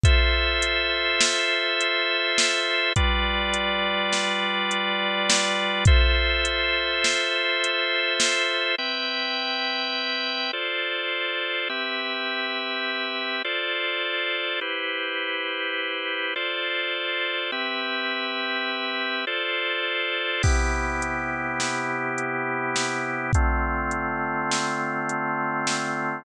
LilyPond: <<
  \new Staff \with { instrumentName = "Drawbar Organ" } { \time 5/4 \key c \major \tempo 4 = 103 <f' a' c'' e''>1~ <f' a' c'' e''>4 | <g f' b' d''>1~ <g f' b' d''>4 | <f' a' c'' e''>1~ <f' a' c'' e''>4 | <c' b' e'' g''>2. <f' a' c'' d''>2 |
<c' g' b' e''>2. <f' a' c'' d''>2 | <e' g' b' c''>2. <f' a' c'' d''>2 | <c' g' b' e''>2. <f' a' c'' d''>2 | <c b e' g'>1~ <c b e' g'>4 |
<d a c' f'>1~ <d a c' f'>4 | }
  \new DrumStaff \with { instrumentName = "Drums" } \drummode { \time 5/4 <hh bd>4 hh4 sn4 hh4 sn4 | <hh bd>4 hh4 sn4 hh4 sn4 | <hh bd>4 hh4 sn4 hh4 sn4 | r4 r4 r4 r4 r4 |
r4 r4 r4 r4 r4 | r4 r4 r4 r4 r4 | r4 r4 r4 r4 r4 | <cymc bd>4 hh4 sn4 hh4 sn4 |
<hh bd>4 hh4 sn4 hh4 sn4 | }
>>